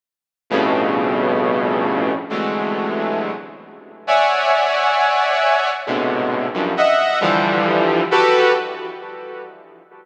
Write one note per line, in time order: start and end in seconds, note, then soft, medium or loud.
0.50 2.11 F2 medium
0.50 2.11 G2 medium
0.50 2.11 A2 medium
0.50 2.11 B2 medium
0.50 2.11 C#3 medium
2.30 3.31 C3 medium
2.30 3.31 D3 medium
2.30 3.31 E3 medium
2.30 3.31 F#3 medium
2.30 3.31 G#3 medium
2.30 3.31 A3 medium
4.07 5.68 C#5 medium
4.07 5.68 D5 medium
4.07 5.68 E5 medium
4.07 5.68 F#5 medium
4.07 5.68 G#5 medium
5.87 6.47 G#2 medium
5.87 6.47 A2 medium
5.87 6.47 B2 medium
5.87 6.47 C3 medium
5.87 6.47 D3 medium
6.54 6.74 F2 medium
6.54 6.74 F#2 medium
6.54 6.74 G2 medium
6.77 7.17 D#5 medium
6.77 7.17 E5 medium
6.77 7.17 F#5 medium
7.21 8.01 D3 loud
7.21 8.01 E3 loud
7.21 8.01 F3 loud
7.21 8.01 G3 loud
8.11 8.51 F#4 loud
8.11 8.51 G4 loud
8.11 8.51 A4 loud
8.11 8.51 B4 loud